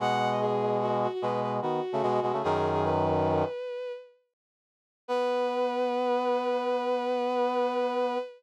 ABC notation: X:1
M:6/4
L:1/16
Q:1/4=148
K:Bmix
V:1 name="Violin"
f3 d G4 F2 F F B2 B z F8 | "^rit." G3 G B12 z8 | B24 |]
V:2 name="Brass Section"
[B,,G,]12 [B,,G,]4 [D,B,]2 z [C,A,] [B,,G,]2 [B,,G,] [C,A,] | "^rit." [F,,D,]10 z14 | B,24 |]